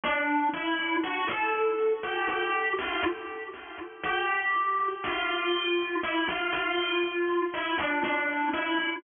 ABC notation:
X:1
M:4/4
L:1/16
Q:1/4=60
K:Bblyd
V:1 name="Marimba"
D2 E2 | ^F A3 G G2 =F z4 G4 | F4 E F F4 E D D2 E2 |]